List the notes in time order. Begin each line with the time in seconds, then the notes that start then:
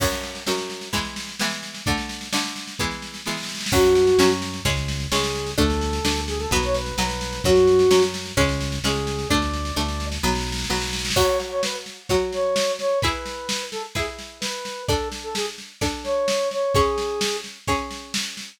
0.00 F#2 F#3 C#4, kick, snare, crash
0.12 snare
0.23 snare
0.35 snare
0.47 F#2 F#3 C#4, snare
0.58 snare
0.70 snare
0.81 snare
0.93 E3 G#3 B3, kick, snare
1.05 snare
1.16 snare
1.28 snare
1.40 E3 G#3 B3, snare
1.51 snare
1.63 snare
1.74 snare
1.86 D3 A3 D4, kick, snare
1.98 snare
2.09 snare
2.21 snare
2.33 D3 A3 D4, snare
2.44 snare
2.56 snare
2.67 snare
2.79 E3 G#3 B3, kick, snare
2.91 snare
3.02 snare
3.14 snare
3.26 E3 G#3 B3, snare
3.31 snare
3.37 snare
3.43 snare
3.49 snare
3.55 snare
3.61 snare
3.66 snare
3.72 F#2 F#3 C#4 F#4, kick, snare, crash
3.84 snare
3.95 snare
4.07 snare
4.18 F#2 F#3 C#4, snare
4.30 snare
4.42 snare
4.53 snare
4.65 C#2 G#3 C#4, kick, snare
4.77 snare
4.88 snare
5.00 snare
5.12 C#2 G#3 C#4 G#4, snare
5.23 snare
5.35 snare
5.47 snare
5.58 D2 A3 D4 A4, kick, snare
5.70 snare
5.81 snare
5.93 snare
6.05 D2 A3 D4, snare
6.16 snare
6.27 G#4, snare
6.39 A4, snare
6.51 B1 F#3 B3 B4, kick, snare
6.63 C#5, snare
6.74 B4, snare
6.86 snare
6.98 B1 F#3 B3 B4, snare
7.09 snare
7.21 snare
7.33 snare
7.44 F#2 F#3 C#4 F#4, kick, snare
7.56 snare
7.67 snare
7.79 snare
7.91 F#2 F#3 C#4, snare
8.02 snare
8.14 snare
8.26 snare
8.37 C#2 G#3 C#4, kick, snare
8.49 snare
8.60 snare
8.72 snare
8.84 C#2 G#3 C#4 G#4, snare
8.95 snare
9.07 snare
9.19 snare
9.29 D2 A3 D4 D5, kick, snare
9.42 snare
9.53 snare
9.65 snare
9.76 D2 A3 D4, snare
9.88 snare
10.00 snare
10.12 snare
10.23 B1 F#3 B3, snare
10.29 snare
10.35 snare
10.41 snare
10.47 snare
10.52 snare
10.58 snare
10.64 snare
10.70 B1 F#3 B3, snare
10.76 snare
10.81 snare
10.87 snare
10.93 snare
10.99 snare
11.05 snare
11.10 snare
11.16 F#3 F#4 C#5, kick, snare, crash
11.40 snare
11.51 C#5
11.63 B4, snare
11.86 snare
12.09 F#3 F#4 C#5, kick, snare
12.33 C#5, snare
12.56 snare
12.79 C#5, snare
13.01 E4 G#4 B4, kick, snare
13.26 snare
13.49 snare
13.72 A4, snare
13.95 E4 G#4 B4, kick, snare
14.19 snare
14.41 B4, snare
14.65 snare
14.88 D4 A4 D5, kick, snare
15.12 snare
15.23 A4
15.35 G#4, snare
15.58 snare
15.81 D4 A4 D5, kick, snare
16.04 C#5, snare
16.28 snare
16.51 C#5, snare
16.75 C#4 G#4 C#5, kick, snare
16.98 snare
17.21 snare
17.44 snare
17.67 C#4 G#4 C#5, kick, snare
17.91 snare
18.14 snare
18.37 snare